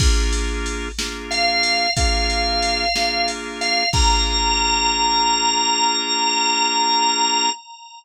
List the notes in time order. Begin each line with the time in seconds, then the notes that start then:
0.00 A#3 D4 F4 G#4, kick, crash
0.33 ride
0.66 ride
0.98 A#3 D4 F4 G#4, snare
1.31 F5, ride
1.63 ride
1.97 A#3 D4 F4 G#4 F5, kick, ride
2.30 ride
2.62 ride
2.95 A#3 D4 F4 G#4, snare
3.28 ride
3.61 F5, ride
3.93 A#3 D4 F4 G#4 A#5, kick, crash